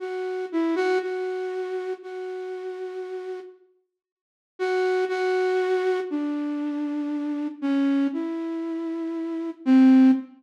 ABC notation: X:1
M:4/4
L:1/8
Q:1/4=118
K:none
V:1 name="Flute"
^F2 E F F4 | ^F6 z2 | z2 ^F2 F4 | D6 ^C2 |
E6 C2 |]